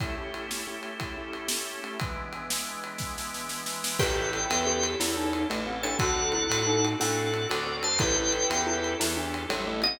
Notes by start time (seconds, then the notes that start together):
0.00 A3 C#4 E4 G4, kick, ride
0.17 A3 C#4 E4 G4
0.34 ride
0.49 A3 C#4 E4 G4, snare
0.67 A3 C#4 E4 G4
0.83 ride
0.99 A3 C#4 E4 G4, kick, ride
1.17 A3 C#4 E4 G4
1.33 ride
1.48 A3 C#4 E4 G4, snare
1.83 A3 C#4 E4 G4, ride
1.99 E3 G#3 B3 D4, kick, ride
2.33 ride
2.50 snare
2.84 ride
2.98 kick, snare
3.18 snare
3.34 snare
3.49 snare
3.66 snare
3.84 snare
3.99 A1 C#4 E4 G4 A4 B4 G5, kick, crash
4.18 C#4 E4 G4 A4
4.32 C#4 E4 G4 A4, ride
4.50 E2 C#4 E4 G4 A4, ride
4.65 C#4 E4 G4 A4
4.83 ride
5.00 E2 C#4 E4 G4 A4, snare
5.17 D#4
5.33 ride
5.49 A1 A3 C#4 E4 G4 A4, ride
5.66 C4 C#4 E4 G4 A4
5.83 C#4 D4 E4 G4 A4 C#5 A5, ride
5.99 D2 C4 D4 F#4 A4 F#5, kick, ride
6.15 C4 D4 F#4 A4
6.32 C4 D4 E4 F#4 A4, ride
6.50 A2 C4 D4 F#4 A4, ride
6.67 C4 D4 D#4 F#4 A4
6.85 ride
6.99 A2 C4 D4 F#4 A4 F#5, snare
7.34 ride
7.49 D2 C4 D4 F#4 A4 D5, ride
7.67 C4 D4 F#4 A4
7.83 C4 D4 F#4 A4 C5 A5, ride
7.99 A1 C#4 E4 G4 A4 B4 G5, kick, ride
8.16 C#4 E4 G4 A4
8.32 C#4 E4 G4 A4, ride
8.50 E2 C#4 E4 G4 A4, ride
8.67 C#4 E4 G4 A4
8.84 ride
8.99 E2 C#4 E4 G4 A4, snare
9.17 D4
9.34 ride
9.49 A1 G3 C#4 E4 G4 A4, ride
9.67 A3 C#4 E4 G4 A4
9.82 C4 C#4 E4 G4 A4 D#5, ride